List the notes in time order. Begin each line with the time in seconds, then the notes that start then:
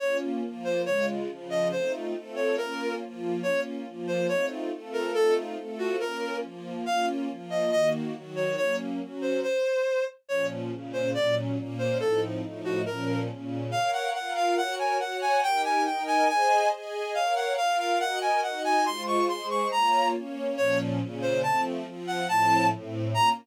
0.00 A#3 C#4 F4 C#5
0.42 F3 A#3 F4
0.64 C5
0.85 C#3 G#3 F4 C#5
1.29 C#3 F3 F4
1.50 D#5
1.71 A3 C4 D#4 F4 C5
2.14 A3 C4 F4 A4
2.36 C#5
2.57 A#3 C#4 F4 A#4
3.01 F3 A#3 F4
3.43 A#3 C#4 F4 C#5
3.86 F3 A#3 F4
4.07 C5
4.27 A3 C4 D#4 F4 C#5
4.71 A3 C4 F4 A4
4.93 A#4
5.14 A3 C4 D#4 F4 A4
5.57 A3 C4 F4 A4
5.78 F#4
6.00 A#3 C#4 F4 A#4
6.41 F3 A#3 F4
6.86 A#3 C#4 F4 F5
7.29 F3 A#3 F4
7.50 D#5
7.71 D#3 A#3 F#4 D#5
8.14 D#3 F#3 F#4
8.36 C#5
8.57 F#3 A#3 C#4 C#5
9.00 F#3 C#4 F#4
9.21 C5
9.43 C5
10.29 A#2 F3 C#4 C#5
10.71 A#2 C#3 C#4
10.93 C5
11.14 A#2 F#3 C#4 D5
11.57 A#2 A#3 C#4
11.79 C5
12.00 A2 F3 C4 D#4 A4
12.42 A2 F3 A3 D#4
12.64 F#4
12.86 A#2 F3 C#4 A#4
13.29 A#2 C#3 C#4
13.71 A#4 C#5 F5
13.93 F#5
14.13 F4 A#4 F5 F#5
14.36 F5
14.57 F#4 A#4 C#5 F#5
14.79 G#5
14.99 F#4 C#5 F#5
15.21 G#5
15.43 D#4 G4 A#4 G5
15.64 G#5
15.85 D#4 A#4 D#5 G5
16.07 G#5
16.28 G#4 C5 D#5 G#5
16.72 G#4 D#5 G#5
17.14 A#4 C#5 F5
17.36 F#5
17.57 F4 A#4 F5
17.79 F5
18.00 F#4 A#4 D#5 F#5
18.21 G#5
18.43 D#4 F#4 D#5 F#5
18.64 G#5
18.86 G#3 F4 C5 C6
19.07 C#6
19.29 G#3 G#4 C5 C6
19.50 C#6
19.71 A#3 F4 C#5 A#5
20.13 A#3 C#4 C#5
20.57 A#2 F3 C#4 C#5
21.00 A#2 C#3 C#4
21.22 C5
21.42 F3 A3 C4 A5
21.86 F3 C4 F4
22.07 F#5
22.27 A2 F3 C4 A5
22.72 A2 A3 C4
23.14 A#3 C#4 F4 A#5